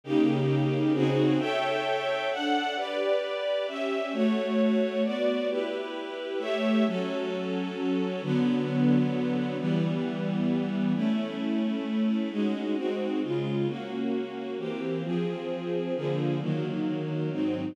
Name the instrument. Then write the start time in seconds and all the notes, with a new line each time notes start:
string ensemble 1
0.04 C#3 A#3 D#4 G4
0.93 C#3 C4 D#4 F#4 G#4
1.39 A4 C#5 E5 G5
2.31 D4 A4 F#5
2.76 G4 B4 D5
3.67 C#4 G4 E5
4.13 A3 F#4 C#5
5.04 B3 F#4 D5
5.49 E4 G4 B4
6.39 A3 G4 C#5 E5
6.86 F#3 C#4 A4
8.22 D3 F#3 B3
9.58 E3 G3 B3
10.94 A3 C#4 E4
12.31 G#3 C#4 D#4 F#4
12.76 G#3 C4 D#4 F#4
13.22 C#3 G#3 F4
13.67 A#3 C#4 F#4
14.58 E3 A#3 C4 G4
15.03 F3 C4 G#4
15.95 D3 F3 A#3 G#4
16.40 D#3 F#3 A#3
17.31 G#2 F#3 C4 D#4